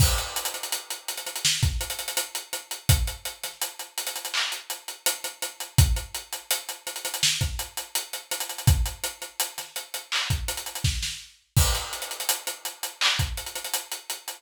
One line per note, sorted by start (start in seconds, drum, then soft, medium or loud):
0.00 kick medium
0.00 crash loud
0.18 closed hi-hat medium
0.36 closed hi-hat medium
0.45 closed hi-hat medium
0.54 closed hi-hat medium
0.63 closed hi-hat medium
0.72 closed hi-hat medium
0.90 closed hi-hat medium
1.08 closed hi-hat medium
1.17 closed hi-hat medium
1.27 closed hi-hat medium
1.36 closed hi-hat medium
1.45 snare medium
1.63 kick medium
1.63 snare soft
1.63 closed hi-hat medium
1.81 closed hi-hat medium
1.90 closed hi-hat medium
1.99 closed hi-hat medium
2.08 closed hi-hat medium
2.17 closed hi-hat medium
2.35 closed hi-hat medium
2.53 closed hi-hat medium
2.71 closed hi-hat medium
2.89 kick medium
2.89 closed hi-hat loud
3.07 closed hi-hat medium
3.25 closed hi-hat medium
3.44 snare soft
3.44 closed hi-hat medium
3.62 closed hi-hat medium
3.79 closed hi-hat medium
3.98 closed hi-hat medium
4.07 closed hi-hat medium
4.16 closed hi-hat medium
4.25 closed hi-hat medium
4.34 clap medium
4.52 closed hi-hat medium
4.70 closed hi-hat medium
4.88 closed hi-hat medium
5.06 closed hi-hat loud
5.24 closed hi-hat medium
5.42 closed hi-hat medium
5.60 closed hi-hat medium
5.78 kick loud
5.78 closed hi-hat medium
5.96 closed hi-hat medium
6.14 closed hi-hat medium
6.33 closed hi-hat medium
6.51 closed hi-hat medium
6.69 closed hi-hat medium
6.87 closed hi-hat medium
6.96 closed hi-hat medium
7.05 closed hi-hat medium
7.14 closed hi-hat medium
7.23 snare medium
7.41 kick medium
7.41 closed hi-hat medium
7.59 closed hi-hat medium
7.77 closed hi-hat medium
7.95 closed hi-hat medium
8.13 closed hi-hat medium
8.31 closed hi-hat medium
8.40 closed hi-hat medium
8.49 closed hi-hat medium
8.58 closed hi-hat medium
8.67 kick loud
8.67 closed hi-hat medium
8.86 closed hi-hat medium
9.04 closed hi-hat medium
9.22 closed hi-hat medium
9.40 closed hi-hat medium
9.58 snare soft
9.58 closed hi-hat medium
9.76 closed hi-hat medium
9.94 closed hi-hat medium
10.12 clap medium
10.30 kick medium
10.30 closed hi-hat medium
10.48 closed hi-hat medium
10.57 closed hi-hat medium
10.66 closed hi-hat medium
10.75 closed hi-hat medium
10.84 kick medium
10.84 snare medium
11.03 snare medium
11.56 kick medium
11.56 crash loud
11.75 snare soft
11.75 closed hi-hat medium
11.93 closed hi-hat medium
12.02 closed hi-hat medium
12.11 closed hi-hat medium
12.20 closed hi-hat medium
12.29 closed hi-hat loud
12.47 closed hi-hat medium
12.65 closed hi-hat medium
12.83 closed hi-hat medium
13.01 clap loud
13.19 kick medium
13.19 closed hi-hat medium
13.37 closed hi-hat medium
13.46 closed hi-hat medium
13.55 closed hi-hat medium
13.64 closed hi-hat medium
13.73 closed hi-hat medium
13.92 closed hi-hat medium
14.10 closed hi-hat medium
14.28 closed hi-hat medium